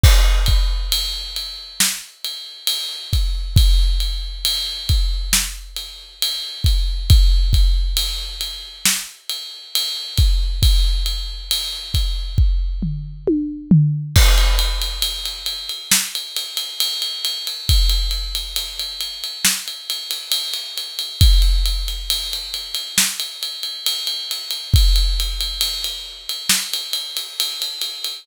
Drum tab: CC |x---------------|----------------|----------------|----------------|
RD |--x-x-x---x-x-x-|x-x-x-x---x-x-x-|x-x-x-x---x-x-x-|x-x-x-x---------|
SD |--------o-------|--------o-------|--------o-------|----------------|
T1 |----------------|----------------|----------------|------------o---|
FT |----------------|----------------|----------------|----------o---o-|
BD |o-o-----------o-|o-----o-------o-|o-o-----------o-|o-----o-o-------|

CC |x---------------|----------------|----------------|----------------|
RD |-xxxxxxx-xxxxxxx|xxxxxxxx-xxxxxxx|xxxxxxxx-xxxxxxx|xxxxxx-xxxxxxxxx|
SD |--------o-------|--------o-------|--------o-------|--------o-------|
T1 |----------------|----------------|----------------|----------------|
FT |----------------|----------------|----------------|----------------|
BD |o---------------|o---------------|o---------------|o---------------|